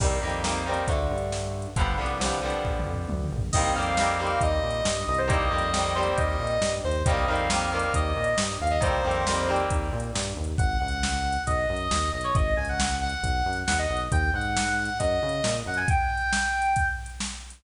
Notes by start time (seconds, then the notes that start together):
0.00 C2 D#3 G3 A#3 C4, kick, crash
0.22 F2 D#3 G3 A#3 C4
0.29 closed hi-hat
0.44 D#3 G3 A#3 C4, snare
0.66 D#3 G3 A#3 C4
0.74 closed hi-hat
0.87 D2 D3 A3, kick, closed hi-hat
1.11 G2
1.18 closed hi-hat
1.32 snare
1.62 closed hi-hat
1.76 G1 D3 F3 G3 B3, kick, closed hi-hat
1.98 C2 D3 F3 G3 B3
2.06 closed hi-hat
2.20 D3 F3 G3 B3, snare
2.42 D3 F3 G3 B3
2.50 closed hi-hat
2.65 A#1, kick
2.79 mid tom
2.86 F2
2.94 floor tom
3.09 D2, high tom
3.24 mid tom
3.31 A#1
3.38 floor tom
3.53 C2 D#3 G3 A#3 D#5, kick, crash
3.57 C4
3.75 F2 D#3 G3 A#3 C4 F5
3.82 closed hi-hat
3.97 D#3 G3 A#3 C4, snare
4.19 D#3 G3 A#3 C4
4.27 closed hi-hat
4.41 D#2 D#5, kick, closed hi-hat
4.63 A#2
4.70 closed hi-hat
4.85 G2, snare
5.07 C2 D#5
5.14 C5, closed hi-hat
5.28 D#3 G3 A#3 C4 D#5, kick, closed hi-hat
5.51 F2 D#3 G3 A#3 C4
5.58 closed hi-hat
5.73 D#3 G3 A#3 C4, snare
5.95 D#3 G3 A#3 C4 C5
6.03 closed hi-hat
6.17 D#2 D#5, kick, closed hi-hat
6.39 A#2
6.47 closed hi-hat
6.61 G2, snare
6.84 D#2 C5
6.91 closed hi-hat
7.06 C2 D#3 G3 A#3 C4 D#5, kick, closed hi-hat
7.28 F2 D#3 G3 A#3 C4 F5
7.35 closed hi-hat
7.50 D#3 G3 A#3 C4, snare
7.72 D#3 G3 A#3 C4
7.79 closed hi-hat
7.94 D#2 D#5, kick, closed hi-hat
8.16 A#2
8.24 closed hi-hat
8.38 G2, snare
8.60 D#2 F5
8.67 D#5, closed hi-hat
8.81 C2 D#3 G3 A#3 C4 C5, kick, closed hi-hat
9.04 F2 D#3 G3 A#3 C4
9.11 closed hi-hat
9.27 D#3 G3 A#3 C4, snare
9.48 D#3 G3 A#3 C4
9.56 closed hi-hat
9.70 D#2, kick, closed hi-hat
9.93 A#2
10.00 closed hi-hat
10.15 G2, snare
10.36 D#2
10.44 closed hi-hat
10.58 G#1 F#5, kick, closed hi-hat
10.80 C#2 F#5
10.88 closed hi-hat
11.03 snare
11.32 closed hi-hat
11.47 B1 D#5, kick, closed hi-hat
11.69 F#2
11.76 closed hi-hat
11.91 D#2, snare
12.12 B1 D#5
12.21 C#5, closed hi-hat
12.35 G#1 D#5, kick, closed hi-hat
12.56 C#2 G#5
12.65 closed hi-hat
12.69 F#5
12.80 snare
13.01 F#5
13.09 closed hi-hat
13.23 B1, kick, closed hi-hat
13.45 F#2
13.53 closed hi-hat
13.67 D#2 F#5, snare
13.79 D#5
13.90 B1
13.97 closed hi-hat
14.12 D#2 G5, kick, closed hi-hat
14.34 G#2 F#5
14.41 closed hi-hat
14.57 snare
14.85 closed hi-hat
14.99 F#2 D#5, kick, closed hi-hat
15.22 C#3
15.29 closed hi-hat
15.44 A#2, snare
15.66 F#2 F#5
15.74 G#5, closed hi-hat
15.88 G5, kick, closed hi-hat
16.17 closed hi-hat
16.33 snare
16.62 closed hi-hat
16.76 kick, closed hi-hat
17.06 closed hi-hat
17.20 snare
17.50 closed hi-hat